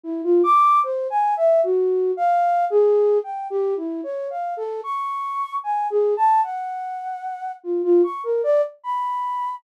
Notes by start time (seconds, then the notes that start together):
0.04 E4
0.24 F4
0.44 D6
0.84 C5
1.10 G#5
1.37 E5
1.64 F#4
2.17 F5
2.70 G#4
3.24 G5
3.50 G4
3.77 E4
4.04 C#5
4.30 F5
4.57 A4
4.83 C#6
5.64 G#5
5.90 G#4
6.17 A5
6.44 F#5
7.64 F4
7.84 F4
8.04 C#6
8.24 A#4
8.44 D5
8.84 B5